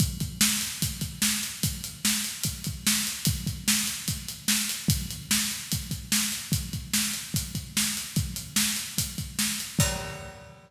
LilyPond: \new DrumStaff \drummode { \time 4/4 \tempo 4 = 147 <hh bd>8 <hh bd>8 sn8 hh8 <hh bd>8 <hh bd>8 sn8 hh8 | <hh bd>8 hh8 sn8 hh8 <hh bd>8 <hh bd>8 sn8 hh8 | <hh bd>8 <hh bd>8 sn8 hh8 <hh bd>8 hh8 sn8 hh8 | <hh bd>8 hh8 sn8 hh8 <hh bd>8 <hh bd>8 sn8 hh8 |
<hh bd>8 <hh bd>8 sn8 hh8 <hh bd>8 <hh bd>8 sn8 hh8 | <hh bd>8 hh8 sn8 hh8 <hh bd>8 <hh bd>8 sn8 hh8 | <cymc bd>4 r4 r4 r4 | }